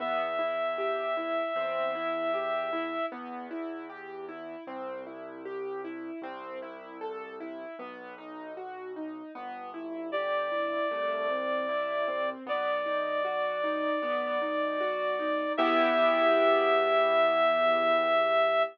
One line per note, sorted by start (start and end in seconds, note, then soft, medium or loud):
0.00 1.43 E2 medium
0.00 0.35 B3 medium
0.00 3.06 E5 medium
0.39 0.74 E4 medium
0.78 1.13 G4 medium
1.17 1.52 E4 medium
1.56 2.99 E2 medium
1.56 1.91 C4 medium
1.95 2.30 E4 medium
2.34 2.69 G4 medium
2.73 3.08 E4 medium
3.12 4.56 E2 medium
3.12 3.47 B3 medium
3.51 3.86 E4 medium
3.90 4.25 G4 medium
4.29 4.64 E4 medium
4.67 6.11 C2 medium
4.67 5.02 C4 medium
5.06 5.42 E4 medium
5.45 5.81 G4 medium
5.84 6.19 E4 medium
6.22 7.65 C2 medium
6.22 6.58 C4 medium
6.62 6.97 E4 medium
7.01 7.36 A4 medium
7.40 7.75 E4 medium
7.79 9.22 B1 medium
7.79 8.14 B3 medium
8.18 8.53 D#4 medium
8.57 8.92 F#4 medium
8.96 9.31 D#4 medium
9.35 10.79 G1 medium
9.35 9.70 B3 medium
9.74 10.09 E4 medium
10.12 10.48 G4 medium
10.12 12.30 D5 medium
10.52 10.87 E4 medium
10.91 12.35 C2 medium
10.91 11.26 A3 medium
11.30 11.65 C4 medium
11.69 12.04 E4 medium
12.08 12.43 C4 medium
12.46 13.90 B1 medium
12.46 12.82 B3 medium
12.46 15.53 D5 medium
12.86 13.21 D#4 medium
13.25 13.60 F#4 medium
13.64 13.99 D#4 medium
14.02 15.45 B1 medium
14.02 14.38 B3 medium
14.42 14.77 D#4 medium
14.81 15.16 F#4 medium
15.19 15.55 D#4 medium
15.57 18.63 E2 loud
15.57 18.64 B3 loud
15.57 18.64 E4 loud
15.57 18.64 G4 loud
15.57 18.63 E5 loud